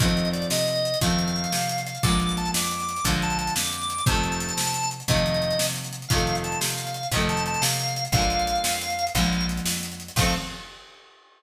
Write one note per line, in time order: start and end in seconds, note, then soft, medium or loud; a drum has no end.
0.00 0.46 F2 loud
0.00 0.92 D#3 medium
0.00 0.92 F3 medium
0.00 0.92 A3 medium
0.00 0.29 D#5 loud
0.00 kick loud
0.00 closed hi-hat loud
0.05 0.92 C4 medium
0.05 closed hi-hat medium
0.17 closed hi-hat medium
0.25 closed hi-hat medium
0.33 0.47 D5 medium
0.33 closed hi-hat medium
0.42 closed hi-hat medium
0.50 0.96 C3 medium
0.50 0.99 D#5 loud
0.50 snare loud
0.59 closed hi-hat medium
0.68 closed hi-hat medium
0.76 closed hi-hat medium
0.85 closed hi-hat medium
0.94 closed hi-hat medium
1.01 1.47 F2 loud
1.01 1.93 D#3 medium
1.01 1.93 F3 medium
1.01 1.93 A3 medium
1.01 1.81 F5 loud
1.01 kick medium
1.01 closed hi-hat loud
1.07 1.93 C4 medium
1.07 closed hi-hat medium
1.19 closed hi-hat medium
1.28 closed hi-hat medium
1.36 closed hi-hat medium
1.44 closed hi-hat medium
1.52 1.98 C3 medium
1.52 snare medium
1.61 closed hi-hat medium
1.69 closed hi-hat medium
1.78 closed hi-hat medium
1.87 2.03 F5 medium
1.87 closed hi-hat medium
1.95 closed hi-hat medium
2.03 2.50 A#1 loud
2.03 2.95 D3 medium
2.03 2.95 F3 medium
2.03 2.95 G#3 medium
2.03 2.36 D6 loud
2.03 kick loud
2.03 closed hi-hat loud
2.08 2.95 A#3 medium
2.08 closed hi-hat medium
2.20 closed hi-hat medium
2.29 closed hi-hat medium
2.37 2.51 A5 loud
2.37 closed hi-hat medium
2.45 closed hi-hat medium
2.54 3.00 F2 medium
2.54 3.05 D6 medium
2.54 snare loud
2.63 closed hi-hat medium
2.71 closed hi-hat medium
2.80 closed hi-hat medium
2.89 closed hi-hat medium
2.96 closed hi-hat medium
3.04 3.50 A#1 medium
3.04 3.97 D3 medium
3.04 3.97 F3 medium
3.04 kick medium
3.04 closed hi-hat loud
3.08 3.97 G#3 medium
3.08 3.97 A#3 medium
3.13 closed hi-hat medium
3.22 3.38 A5 loud
3.22 closed hi-hat medium
3.30 closed hi-hat medium
3.39 3.54 A5 loud
3.39 closed hi-hat medium
3.47 closed hi-hat medium
3.55 4.02 F2 medium
3.55 4.05 D6 medium
3.55 snare loud
3.65 closed hi-hat medium
3.73 closed hi-hat medium
3.82 closed hi-hat medium
3.90 closed hi-hat medium
3.98 closed hi-hat medium
4.06 4.52 F2 loud
4.06 4.98 C3 medium
4.06 4.98 D#3 medium
4.06 4.90 A5 loud
4.06 kick loud
4.06 closed hi-hat medium
4.10 4.98 F3 medium
4.10 4.98 A3 medium
4.15 closed hi-hat medium
4.24 closed hi-hat medium
4.32 closed hi-hat medium
4.40 closed hi-hat medium
4.49 closed hi-hat medium
4.57 5.03 C3 medium
4.57 snare loud
4.65 closed hi-hat medium
4.74 closed hi-hat medium
4.83 closed hi-hat medium
4.91 closed hi-hat medium
5.00 closed hi-hat medium
5.08 5.54 F2 loud
5.08 6.00 C3 medium
5.08 6.00 D#3 medium
5.08 6.00 F3 medium
5.08 5.66 D#5 loud
5.08 kick medium
5.08 closed hi-hat medium
5.14 6.00 A3 medium
5.14 closed hi-hat medium
5.26 closed hi-hat medium
5.34 closed hi-hat medium
5.42 closed hi-hat medium
5.51 closed hi-hat medium
5.59 6.06 C3 medium
5.59 snare loud
5.68 closed hi-hat medium
5.76 closed hi-hat medium
5.84 closed hi-hat medium
5.93 closed hi-hat medium
6.02 closed hi-hat medium
6.08 6.56 F2 loud
6.08 7.02 C3 medium
6.08 7.02 D#3 medium
6.08 6.36 F5 loud
6.08 kick loud
6.08 closed hi-hat loud
6.14 7.02 F3 medium
6.14 7.02 A3 medium
6.18 closed hi-hat medium
6.27 closed hi-hat medium
6.35 closed hi-hat medium
6.44 6.60 A5 medium
6.44 closed hi-hat medium
6.52 closed hi-hat medium
6.61 7.07 C3 medium
6.61 7.08 F5 medium
6.61 snare loud
6.70 closed hi-hat medium
6.78 closed hi-hat medium
6.87 closed hi-hat medium
6.94 closed hi-hat medium
7.03 closed hi-hat medium
7.12 7.57 F2 loud
7.12 8.04 C3 medium
7.12 8.04 D#3 medium
7.12 8.04 F3 medium
7.12 kick medium
7.12 closed hi-hat loud
7.17 8.04 A3 medium
7.17 closed hi-hat medium
7.29 7.44 A5 loud
7.29 closed hi-hat medium
7.37 closed hi-hat medium
7.46 7.63 A5 loud
7.46 closed hi-hat medium
7.54 closed hi-hat medium
7.62 8.08 C3 loud
7.62 8.04 F5 medium
7.62 snare loud
7.71 closed hi-hat medium
7.80 closed hi-hat medium
7.88 closed hi-hat medium
7.96 closed hi-hat medium
8.05 closed hi-hat medium
8.12 8.58 A#1 loud
8.12 9.05 D3 medium
8.12 9.05 F3 medium
8.12 9.05 F5 loud
8.12 kick loud
8.12 closed hi-hat medium
8.17 9.05 G#3 medium
8.17 9.05 A#3 medium
8.22 closed hi-hat medium
8.30 closed hi-hat medium
8.39 closed hi-hat medium
8.47 closed hi-hat medium
8.55 closed hi-hat medium
8.64 9.10 F2 medium
8.64 snare loud
8.73 closed hi-hat medium
8.81 closed hi-hat medium
8.90 closed hi-hat medium
8.99 closed hi-hat medium
9.07 closed hi-hat medium
9.15 9.61 A#1 loud
9.15 10.07 D3 medium
9.15 10.07 F3 medium
9.15 10.07 G#3 medium
9.15 9.46 F5 loud
9.15 kick medium
9.15 closed hi-hat medium
9.20 10.07 A#3 medium
9.20 closed hi-hat medium
9.33 closed hi-hat medium
9.41 closed hi-hat medium
9.49 closed hi-hat medium
9.57 closed hi-hat medium
9.65 10.11 F2 medium
9.65 snare loud
9.74 closed hi-hat medium
9.83 closed hi-hat medium
9.92 closed hi-hat medium
10.00 closed hi-hat medium
10.08 closed hi-hat medium
10.16 10.34 F2 loud
10.16 10.35 D#3 medium
10.16 10.35 F3 loud
10.16 10.34 F5 loud
10.16 kick loud
10.16 crash loud
10.20 10.35 A3 loud
10.20 10.35 C4 loud